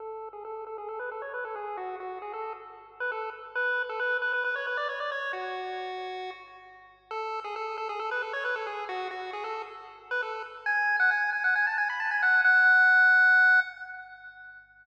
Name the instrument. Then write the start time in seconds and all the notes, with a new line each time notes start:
lead 1 (square)
0.00 A4
0.33 G#4
0.45 A4
0.67 A4
0.78 G#4
0.89 A4
0.99 B4
1.11 A4
1.22 C#5
1.34 B4
1.45 A4
1.56 G#4
1.77 F#4
2.00 F#4
2.22 G#4
2.34 A4
3.00 B4
3.12 A4
3.55 B4
3.89 A4
4.00 B4
4.22 B4
4.33 B4
4.44 B4
4.56 C#5
4.67 B4
4.77 D5
4.89 C#5
5.00 D5
5.12 C#5
5.33 F#4
7.11 A4
7.44 G#4
7.56 A4
7.78 A4
7.89 G#4
8.00 A4
8.11 B4
8.22 A4
8.33 C#5
8.45 B4
8.56 A4
8.67 G#4
8.89 F#4
9.11 F#4
9.33 G#4
9.44 A4
10.11 B4
10.22 A4
10.66 G#5
11.00 F#5
11.11 G#5
11.33 G#5
11.44 F#5
11.55 G#5
11.67 A5
11.78 G#5
11.90 B5
12.00 A5
12.11 G#5
12.22 F#5
12.44 F#5